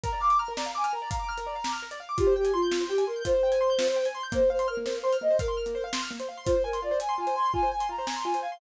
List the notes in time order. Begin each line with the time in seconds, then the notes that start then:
0.03 A#4 A#5, kick, closed hi-hat
0.13 D5
0.20 F5 D6
0.30 D6, closed hi-hat
0.39 A#5 F6
0.48 A#4
0.56 D5 A#5, snare
0.66 F5
0.75 G#5 D6
0.84 F6, closed hi-hat
0.93 A#4 A#5
1.02 D5
1.11 F5 A#5, kick, closed hi-hat
1.19 D6
1.29 F6
1.38 A#4, closed hi-hat
1.46 D5
1.55 F5
1.64 D6, snare
1.73 F6
1.82 A#4
1.91 D5, closed hi-hat
2.00 F5
2.09 D6
2.18 F4 G4, kick, closed hi-hat
2.27 C5
2.36 G4 G5
2.44 G#5, closed hi-hat
2.53 F4 C6
2.62 G6
2.71 F4, snare
2.80 C5
2.89 G4 G5
2.98 G#5, closed hi-hat
3.07 A#4 C6
3.16 G6
3.25 F4 C5, kick, closed hi-hat
3.34 C5
3.43 G5
3.52 G#5, closed hi-hat
3.61 C6
3.70 G6
3.78 F4, snare
3.88 C5
3.96 G5
4.05 G#5, closed hi-hat
4.14 C6
4.23 G6
4.32 A#3 C5, kick, closed hi-hat
4.41 C5
4.50 C5 F5
4.59 C6, closed hi-hat
4.68 A#4 F6
4.77 A#3
4.86 C5, snare
4.94 F5
5.02 C5 C6
5.13 F6, closed hi-hat
5.21 A#3 D#5
5.30 C5
5.39 A#4 F5, kick, closed hi-hat
5.48 C6
5.57 F6
5.66 A#3, closed hi-hat
5.75 C5
5.84 F5
5.93 C6, snare
6.02 F6
6.11 A#3
6.20 C5, closed hi-hat
6.29 F5
6.37 C6
6.45 F4 C5, kick, closed hi-hat
6.56 C5
6.64 A#4 G#5
6.73 C6, closed hi-hat
6.82 F4 D5
6.91 C5
7.00 G#5, closed hi-hat
7.09 C6
7.18 F4 G#5
7.27 C5, closed hi-hat
7.35 G#5 C6
7.45 C6
7.54 F4 G#5, kick
7.63 C5
7.71 G#5
7.80 C6, closed hi-hat
7.89 F4 A#5
7.98 C5
8.07 G#5, snare
8.16 C6
8.24 F4 G#5
8.34 C5, closed hi-hat
8.42 F5 G#5
8.52 C6